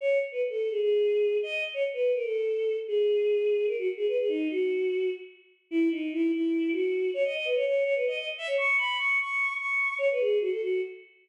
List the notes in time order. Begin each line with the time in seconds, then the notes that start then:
0.01 C#5
0.32 B4
0.49 A4
0.70 G#4
0.81 G#4
1.43 D#5
1.74 C#5
1.93 B4
2.14 A#4
2.24 A4
2.87 G#4
3.66 A#4
3.78 F#4
3.97 G#4
4.08 B4
4.19 G#4
4.28 D#4
4.51 F#4
5.71 E4
5.91 D#4
6.13 E4
6.33 E4
6.72 F#4
7.14 C#5
7.25 D#5
7.35 D#5
7.45 B4
7.55 C#5
7.66 C#5
7.85 C#5
7.95 B4
8.07 D#5
8.17 D#5
8.38 E5
8.47 C#5
8.58 C#6
8.78 B5
8.98 C#6
9.20 C#6
9.58 C#6
9.98 C#5
10.11 B4
10.20 G#4
10.41 F#4
10.51 A4
10.61 F#4